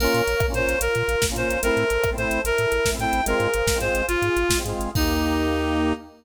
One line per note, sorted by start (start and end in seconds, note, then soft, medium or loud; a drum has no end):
0.00 0.07 A#1 medium
0.00 0.22 A#3 loud
0.00 0.22 C#4 loud
0.00 0.46 A#4 loud
0.00 0.80 A#4 loud
0.00 0.80 C#5 loud
0.00 0.80 F5 medium
0.00 crash loud
0.04 0.22 F4 loud
0.14 0.22 A#2 medium
0.14 closed hi-hat medium
0.27 0.35 A#1 medium
0.27 closed hi-hat medium
0.40 0.48 A#1 medium
0.40 kick loud
0.40 cross-stick loud
0.48 0.53 A#3 loud
0.48 0.53 C#4 loud
0.48 0.55 F4 medium
0.54 0.62 A#2 medium
0.54 0.77 A#3 loud
0.54 0.77 C#4 medium
0.54 0.79 C5 loud
0.54 closed hi-hat medium
0.59 0.77 F4 loud
0.67 0.75 A#1 medium
0.67 closed hi-hat medium
0.81 0.88 A#1 medium
0.81 1.62 F4 medium
0.81 1.26 A#4 loud
0.81 1.62 A#4 loud
0.81 1.62 F5 loud
0.81 closed hi-hat loud
0.95 1.03 A#2 medium
0.95 closed hi-hat medium
1.08 1.16 A#1 medium
1.08 closed hi-hat medium
1.22 1.31 A#1 medium
1.22 kick medium
1.22 snare loud
1.29 1.35 A#3 loud
1.29 1.35 C#4 loud
1.29 1.36 F4 loud
1.36 1.44 A#2 medium
1.36 1.58 A#3 loud
1.36 1.58 C#4 medium
1.36 1.61 C5 medium
1.36 closed hi-hat medium
1.40 1.58 F4 medium
1.49 1.57 A#1 medium
1.49 closed hi-hat medium
1.63 1.71 A1 medium
1.63 1.84 A3 loud
1.63 1.84 C4 loud
1.63 1.84 E4 loud
1.63 2.44 A4 loud
1.63 2.10 A#4 loud
1.63 2.44 C5 loud
1.63 2.44 E5 loud
1.63 closed hi-hat loud
1.77 1.84 A2 medium
1.77 closed hi-hat medium
1.90 1.98 A1 medium
1.90 closed hi-hat medium
2.04 2.13 A1 medium
2.04 kick medium
2.04 cross-stick loud
2.11 2.16 A3 loud
2.11 2.16 C4 loud
2.11 2.18 E4 medium
2.18 2.25 A2 medium
2.18 2.40 A3 medium
2.18 2.40 C4 loud
2.18 2.41 C5 loud
2.18 closed hi-hat medium
2.22 2.40 E4 loud
2.31 2.38 A1 medium
2.31 closed hi-hat medium
2.45 2.52 A1 medium
2.45 3.26 E4 loud
2.45 3.26 A4 medium
2.45 2.90 A#4 loud
2.45 3.26 E5 loud
2.45 closed hi-hat loud
2.58 2.66 A2 medium
2.58 closed hi-hat medium
2.72 2.80 A1 medium
2.72 closed hi-hat medium
2.85 2.94 A1 medium
2.85 kick medium
2.85 snare loud
2.92 2.98 A3 medium
2.92 2.98 C4 loud
2.92 2.99 E4 loud
2.99 3.06 A2 medium
2.99 3.21 A3 medium
2.99 3.21 C4 loud
2.99 3.25 G5 loud
2.99 closed hi-hat medium
3.03 3.21 E4 loud
3.13 3.21 A1 medium
3.13 closed hi-hat medium
3.26 3.34 G#1 medium
3.26 3.48 G#3 loud
3.26 3.48 C4 loud
3.26 3.48 F4 loud
3.26 4.06 G#4 medium
3.26 3.78 A#4 loud
3.26 4.07 C5 medium
3.26 4.06 F5 loud
3.26 closed hi-hat loud
3.40 3.47 G#2 medium
3.40 closed hi-hat medium
3.54 3.62 G#1 medium
3.54 closed hi-hat loud
3.67 3.74 G#1 medium
3.67 kick medium
3.67 snare loud
3.74 3.79 G#3 medium
3.74 3.79 C4 loud
3.74 3.81 F4 loud
3.80 3.89 G#2 medium
3.80 4.02 G#3 loud
3.80 4.02 C4 loud
3.80 4.02 F4 loud
3.80 4.06 C5 loud
3.80 closed hi-hat medium
3.94 4.02 G#1 medium
3.94 closed hi-hat medium
4.07 4.16 G#1 medium
4.07 4.93 F4 loud
4.07 4.58 F4 loud
4.07 4.93 G#4 medium
4.07 4.93 F5 medium
4.07 closed hi-hat loud
4.22 4.30 G#2 medium
4.22 closed hi-hat medium
4.37 4.44 G#1 medium
4.37 closed hi-hat medium
4.49 4.57 G#1 medium
4.49 kick medium
4.49 snare loud
4.57 4.63 G#3 loud
4.57 4.63 C4 loud
4.57 4.64 F4 medium
4.65 4.73 G#2 medium
4.65 4.90 G#3 loud
4.65 4.90 C4 medium
4.65 closed hi-hat medium
4.69 4.90 F4 loud
4.79 4.88 G#1 medium
4.79 closed hi-hat medium
4.95 5.93 D#2 medium
4.95 5.93 A#3 loud
4.95 5.93 D#4 loud
4.95 5.93 G4 medium
4.95 5.93 G4 loud
4.95 kick loud
4.95 crash loud